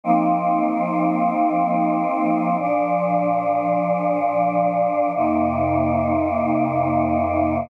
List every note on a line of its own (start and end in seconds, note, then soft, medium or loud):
0.03 2.56 F3 medium
0.03 2.56 A#3 medium
0.03 2.56 C4 medium
0.03 2.56 D#4 medium
2.59 5.11 A#2 medium
2.59 5.11 F3 medium
2.59 5.11 D4 medium
5.14 7.67 F2 medium
5.14 7.67 C3 medium
5.14 7.67 A#3 medium
5.14 7.67 D#4 medium